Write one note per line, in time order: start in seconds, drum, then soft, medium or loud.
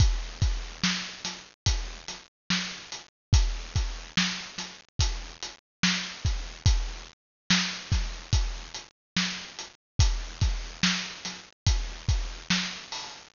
0.00 kick loud
0.00 closed hi-hat loud
0.42 kick loud
0.42 closed hi-hat medium
0.84 snare loud
1.25 snare medium
1.25 closed hi-hat loud
1.66 kick loud
1.66 closed hi-hat loud
2.08 snare soft
2.08 closed hi-hat medium
2.50 snare loud
2.92 closed hi-hat medium
3.33 kick loud
3.33 closed hi-hat loud
3.76 kick loud
3.76 closed hi-hat medium
4.17 snare loud
4.58 snare medium
4.58 closed hi-hat medium
4.99 kick loud
4.99 closed hi-hat loud
5.43 closed hi-hat medium
5.83 snare loud
6.25 kick loud
6.25 closed hi-hat medium
6.66 kick loud
6.66 closed hi-hat loud
7.50 snare loud
7.50 closed hi-hat medium
7.92 kick loud
7.92 snare medium
7.92 closed hi-hat medium
8.33 kick loud
8.33 closed hi-hat loud
8.74 closed hi-hat medium
9.16 snare loud
9.59 closed hi-hat medium
9.99 kick loud
9.99 closed hi-hat loud
10.41 kick loud
10.41 snare medium
10.41 closed hi-hat medium
10.83 snare loud
11.25 snare medium
11.25 closed hi-hat medium
11.66 kick loud
11.66 closed hi-hat loud
12.09 kick loud
12.09 closed hi-hat medium
12.50 snare loud
12.92 open hi-hat medium